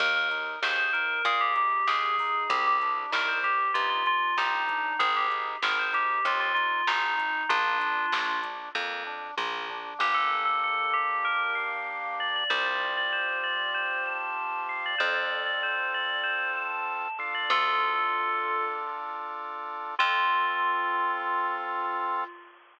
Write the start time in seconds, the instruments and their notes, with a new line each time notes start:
0.00 electric bass (finger) D#2, drawbar organ A#3, tubular bells A#4, kick, crash
0.16 tubular bells A#4
0.31 drawbar organ D#4, closed hi-hat
0.62 electric bass (finger) D#2, drawbar organ G#4, tubular bells C5, snare
0.78 tubular bells C5
0.93 drawbar organ D#4, tubular bells A#4, closed hi-hat
1.25 electric bass (finger) A#2, drawbar organ A#3, tubular bells G#4, kick, closed hi-hat
1.41 tubular bells G4
1.56 drawbar organ D#4, tubular bells G4, closed hi-hat
1.87 electric bass (finger) D#2, tubular bells G#4, drawbar organ G#4, snare
2.18 drawbar organ D#4, kick, open hi-hat
2.49 electric bass (finger) C2, drawbar organ C4, tubular bells G4, kick, closed hi-hat
2.67 tubular bells G4
2.82 drawbar organ D4, closed hi-hat
3.11 electric bass (finger) C2, drawbar organ D#4, tubular bells A#4, snare
3.28 tubular bells C5
3.43 tubular bells G4, drawbar organ G4, kick, closed hi-hat
3.74 electric bass (finger) G2, drawbar organ D#4, tubular bells F4, kick, closed hi-hat
3.89 tubular bells F4
4.06 drawbar organ D4, tubular bells F4, closed hi-hat
4.37 electric bass (finger) C2, drawbar organ C4, tubular bells D#4, snare
4.68 drawbar organ D4, kick, closed hi-hat
4.99 electric bass (finger) G#1, drawbar organ C4, tubular bells G#4, kick, closed hi-hat
5.16 tubular bells G4
5.29 drawbar organ D#4, closed hi-hat
5.62 electric bass (finger) G#1, drawbar organ G#4, tubular bells A#4, snare
5.79 tubular bells C5
5.92 drawbar organ D#4, tubular bells G4, closed hi-hat
6.24 electric bass (finger) D#2, drawbar organ C4, tubular bells F4, kick, closed hi-hat
6.40 tubular bells F4
6.54 drawbar organ D#4, tubular bells F4, closed hi-hat
6.87 electric bass (finger) G#1, tubular bells D#4, drawbar organ G#4, snare, closed hi-hat
7.18 drawbar organ D#4, kick, closed hi-hat
7.49 electric bass (finger) A#1, drawbar organ A#3, tubular bells D4 F4, kick, closed hi-hat
7.79 drawbar organ D4, closed hi-hat
8.12 electric bass (finger) A#1, drawbar organ F4, snare
8.42 drawbar organ D4, kick, closed hi-hat
8.75 electric bass (finger) F2, drawbar organ A#3, kick, high tom
9.06 drawbar organ D4, floor tom
9.37 electric bass (finger) A#1, drawbar organ F4, high tom
9.69 drawbar organ D4, floor tom
9.99 electric bass (finger) G1, drawbar organ A#3 D4 G4, tubular bells G4
10.14 tubular bells A4
10.45 tubular bells A4
10.64 tubular bells A4
10.93 tubular bells G4
11.24 tubular bells A#4
11.55 tubular bells F5
12.20 tubular bells D5
12.36 tubular bells D5
12.50 electric bass (finger) C2, drawbar organ C4 F4 G4, tubular bells C5
12.65 tubular bells D5
12.97 tubular bells D5
13.12 tubular bells C5
13.43 tubular bells D5
13.74 tubular bells C5
14.06 tubular bells A5
14.69 tubular bells F5
14.85 tubular bells D5
14.98 electric bass (finger) F2, drawbar organ C4 F4 A4, tubular bells C5
15.16 tubular bells D5
15.46 tubular bells D5
15.63 tubular bells C5
15.94 tubular bells D5
16.23 tubular bells C5
16.56 tubular bells A5
17.18 drawbar organ D4 F4 A4, tubular bells F5
17.34 tubular bells D5
17.50 electric bass (finger) D2, tubular bells F4 A4
19.99 electric bass (finger) F2, drawbar organ C4 F4 A4, tubular bells F4